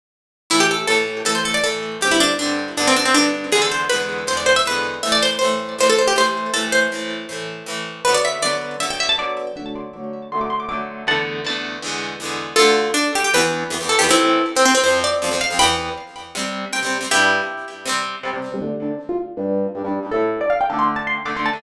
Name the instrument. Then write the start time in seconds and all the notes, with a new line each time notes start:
acoustic guitar (steel)
0.50 A2 E3 A3 E4
0.60 G4
0.71 A4
0.87 A2 E3 A4
0.92 A3
1.25 A2 E3 A3 A4
1.35 C5
1.45 A4
1.54 D5
1.64 A2 E3 A3 A4
2.01 G2 D3 C4 G4
2.11 E4
2.20 D4
2.39 G2 D3 C4 D4
2.77 G2 D3 B3 D4
2.87 C4
2.96 D4
3.05 C4
3.14 G2 D3 B3 D4
3.52 E2 D3 G#3 G#4
3.57 B3
3.62 A4
3.72 C5
3.89 E2 D3 B4
3.94 G#3 B3
4.27 E2 D3 G#3 C5
4.33 B3
4.37 D5
4.46 C5
4.56 E5
4.65 E2 D3 G#3 B4
4.71 B3
5.03 A2 E3 E5
5.07 A3
5.12 D5
5.23 C5
5.39 A2 E3 C5
5.45 A3
5.78 A2 E3 A3 C5
5.89 A4
5.99 C5
6.08 G4
6.16 A2 E3 A3 C5
6.54 A2 E3 A3 A4
6.72 C5
6.92 A2 E3 A3
7.29 A2 E3 A3
7.66 A2 E3 A3
8.05 D3 F#3 B4
8.09 B3
8.14 D5
8.25 E5
8.42 D3 F#3 B3 D5
8.80 D3 F#3 B3 E5
8.90 G5
9.00 E5
9.09 A5
9.18 D3 F#3 B3 D5
9.56 D3 F#3 A3 F#5
9.66 A5
9.75 C6
9.93 D3 F#3 D6
9.97 A3
10.32 D3 F#3 A3 C6
10.41 D6
10.50 C6
10.60 D6
10.69 D3 F#3 A3 D6
11.07 E2 D3 A3 F#5 A5
11.12 B3
11.44 E2 D3 A3 A5
11.50 B3
11.82 E2 D3 G#3
11.88 B3
12.20 E2 D3 G#3
12.25 B3
12.56 D2 D3 F4 A4
12.62 A3
12.94 D4
13.15 G4
13.24 G4
13.34 E2 E3 B3 B4
13.70 E2 E3 B3
13.81 E2 E3 B3
13.89 A4
13.99 E2 E3 G4
14.04 B3
14.09 A2 E3 A3 C4 E4
14.56 C4
14.65 C4
14.75 C4
14.84 F2 F3 C5
14.88 C4
15.04 D5
15.22 F2 F3 C4
15.31 F2 F3 C4
15.41 F5
15.50 F2 F3 C4
15.59 E2 E3 G5 B5
15.63 B3
16.35 C3 G3 C4
16.73 C3 G3 C4 G5
16.83 C3 G3 C4
17.01 C3 G3 C4
17.11 G2 G3 D4 E4 G4
17.86 C3 G3 C4
18.23 C3 G3 C4
18.34 C3 G3 C4
18.52 C3 G3 C4
18.61 D3 A3 D4
18.82 D4
19.09 F4
19.37 G2 G3 D4
19.75 G2 G3 D4
19.84 G2 G3 D4
20.03 G2 G3 D4
20.11 A2 A3 A4
20.16 E4
20.41 D5
20.50 F5
20.61 G5
20.70 D3 A3 D4 A5
20.79 C6
20.96 A5
21.07 C6
21.25 D3 A3 D4 D6
21.35 D3 A3 D4 C6
21.46 A5
21.53 D3 A3 D4